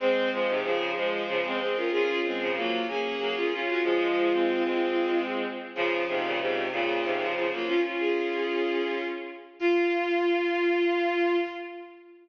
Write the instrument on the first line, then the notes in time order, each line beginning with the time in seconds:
violin
0.00 G#3 C4 C5
0.32 F3 G#3 C5
0.48 G#2 C3
0.63 C#3 F3 G#4
0.96 F3 G#3 C5
1.28 C#3 F3
1.44 G#3 C4
1.60 G#3 C4
1.76 C#4 F4 A#4
1.92 C#4 F4 G#4
2.24 G#3 C4 G#4
2.40 C#3 F3
2.55 F#3 A#3 F4
2.88 A#3 C#4 G#4
3.19 F#3 A#3
3.36 C#4 F4
3.53 C#4 F4
3.67 C#4 F4 F#4
3.83 F3 G#3 F4
4.32 G#3 C4
4.64 G#3 C4
5.75 C#3 F3 F4
6.08 G#2 C3 F4
6.24 A#2 C#3
6.40 G#2 C3 F4
6.71 A#2 C#3 F4
7.04 G#2 C3
7.20 C#3 F3
7.36 C#3 F3
7.52 F#3 A#3 F4
7.67 C#4 F4
7.84 C#4 F4
8.00 G#4
9.59 F4